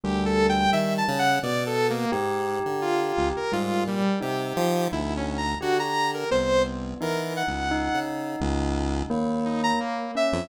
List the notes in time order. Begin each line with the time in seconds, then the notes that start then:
0.04 D2 G3 G4
0.26 A4
0.49 G5
0.72 D#3 E5
0.98 A5
1.08 C#3
1.19 F#5
1.43 B2 D5
1.66 A4
1.90 A#3
2.12 G#2 G4
2.66 D3
2.82 F4
3.17 C#2
3.36 A#4
3.52 G#2 G3 F4
3.87 A#2 G3
4.20 C3 D#4 G4
4.57 F3
4.92 D2 E4
5.17 C#4
5.37 A#5
5.61 D3 F#4 G4
5.79 A#5
6.14 A#4
6.31 C2 B3 C5
7.01 E3 D#4 A#4
7.36 F#5
7.47 C#2
7.71 D#4
7.94 C#3
8.40 C#2
9.10 D#2 A#3
9.45 D#4
9.64 A#5
9.80 A#3
10.15 C#4 E5
10.33 F2